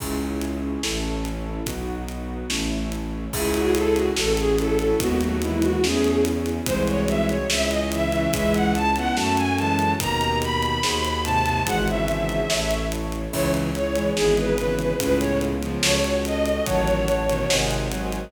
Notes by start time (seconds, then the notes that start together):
0.00 C#2 C#4 E4 G#4, kick, crash
0.41 closed hi-hat
0.83 A1 C#4 E4 A4, snare
1.25 closed hi-hat
1.66 B1 B3 D#4 F#4, kick, closed hi-hat
2.09 closed hi-hat
2.50 A1 A3 C#4 E4, snare
2.92 closed hi-hat
3.33 C#2 C#4 E4 G#4, kick, crash
3.54 F#4, closed hi-hat
3.75 A4, closed hi-hat
3.95 F#4, closed hi-hat
4.16 A1 C#4 F#4 A4, snare
4.37 G#4, closed hi-hat
4.58 C#4 E4 A4, closed hi-hat
4.79 C#4 E4, closed hi-hat
5.00 D#2 G#3 B3 D#4 F#4, kick, closed hi-hat
5.21 F#3 A3 F#4, closed hi-hat
5.42 E3 G#3 E4, closed hi-hat
5.62 F#4, closed hi-hat
5.83 E2 A3 C#4 E4 G#4, snare
6.04 closed hi-hat
6.25 closed hi-hat
6.46 closed hi-hat
6.66 C2 E3 G#3 C4 D#4 F#4 G#4 C5, kick, closed hi-hat
6.88 C#5, closed hi-hat
7.08 E5, closed hi-hat
7.29 C#5, closed hi-hat
7.50 C#2 C#4 E4 G#4 E5, snare
7.70 D#5, closed hi-hat
7.91 C#3 E3 E5, closed hi-hat
8.12 C#3 E3, closed hi-hat
8.32 C#2 E3 G#3 C#4 E4 G#4 E5, kick, closed hi-hat
8.54 F#5, closed hi-hat
8.75 A5, closed hi-hat
8.96 G#3 B3 F#5, closed hi-hat
9.15 F#2 F#3 A3 C#4 F#4 A4 A5, snare
9.37 G#5, closed hi-hat
9.58 E3 G#3 A5, closed hi-hat
9.79 closed hi-hat
10.00 D#2 B2 D#3 D#4 G4 A#4 A#5, kick, closed hi-hat
10.21 closed hi-hat
10.42 B5, closed hi-hat
10.63 closed hi-hat
10.83 D#2 D#4 F#4 G#4 C5, snare
11.05 closed hi-hat
11.24 G#2 C3 A5, closed hi-hat
11.45 G#2 C3, closed hi-hat
11.67 G#1 E3 G#3 D#4 F#4 G#4 C5 F#5, kick, closed hi-hat
11.88 C#3 E3 E5, closed hi-hat
12.08 closed hi-hat
12.29 closed hi-hat
12.50 A1 E4 A4 C#5, snare
12.71 closed hi-hat
12.92 closed hi-hat
13.12 closed hi-hat
13.33 C#2 C#3 E3 C#4 E4 G#4 C#5, kick, crash
13.54 closed hi-hat
13.75 C#5, closed hi-hat
13.95 E3 G#3, closed hi-hat
14.16 G#1 E3 G#3 B3 D#4 G#4, snare
14.37 B4, closed hi-hat
14.57 C#3 E3 B4, closed hi-hat
14.79 B4, closed hi-hat
15.00 C#2 A2 C#3 B3 C#4 F4 G#4 B4, kick, closed hi-hat
15.20 C#5, closed hi-hat
15.41 closed hi-hat
15.62 C#3 F3, closed hi-hat
15.82 C#2 C#4 F#4 A4 C#5, snare
16.04 closed hi-hat
16.25 D#5, closed hi-hat
16.46 closed hi-hat
16.65 A1 D#3 F#3 C#5 F#5 A5, kick, closed hi-hat
16.88 closed hi-hat
17.08 closed hi-hat
17.28 B2 D#3, closed hi-hat
17.49 G#1 C3 D#3 C5 D#5 F#5 G#5, snare
17.71 closed hi-hat
17.91 D#3 F#3, closed hi-hat
18.12 closed hi-hat